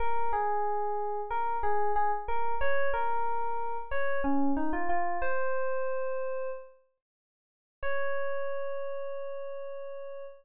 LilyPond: \new Staff { \time 4/4 \key des \major \tempo 4 = 92 bes'8 aes'4. bes'8 aes'8 aes'16 r16 bes'8 | des''8 bes'4. des''8 des'8 ees'16 f'16 f'8 | c''2 r2 | des''1 | }